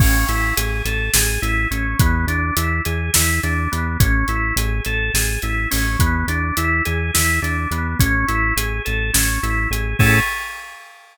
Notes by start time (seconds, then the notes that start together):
0.00 A1 C#4, kick, crash
0.29 A1 E4, closed hi-hat
0.57 A1 G#4, closed hi-hat
0.85 A1 A4, closed hi-hat
1.14 A1 G#4, snare
1.42 A1 E4, closed hi-hat
1.71 A1 C#4, closed hi-hat
2.00 E2 B3, kick, closed hi-hat
2.27 E2 D4, closed hi-hat
2.57 E2 E4, closed hi-hat
2.85 E2 G#4, closed hi-hat
3.14 E2 E4, snare
3.43 E2 D4, closed hi-hat
3.72 E2 B3, closed hi-hat
4.00 A1 C#4, kick, closed hi-hat
4.28 A1 E4, closed hi-hat
4.56 A1 G#4, closed hi-hat
4.85 A1 A4, closed hi-hat
5.14 A1 G#4, snare
5.42 A1 E4, closed hi-hat
5.71 A1 C#4, open hi-hat
6.00 E2 B3, kick, closed hi-hat
6.27 E2 D4, closed hi-hat
6.57 E2 E4, closed hi-hat
6.85 E2 G#4, closed hi-hat
7.14 E2 E4, snare
7.42 E2 D4, closed hi-hat
7.71 E2 B3, closed hi-hat
8.00 A1 C#4, kick, closed hi-hat
8.28 A1 E4, closed hi-hat
8.56 A1 G#4, closed hi-hat
8.85 A1 A4, closed hi-hat
9.14 A1 C#4, snare
9.43 A1 E4, closed hi-hat
9.70 A1 G#4, closed hi-hat
9.99 A2 C#4 E4 G#4 A4, kick, crash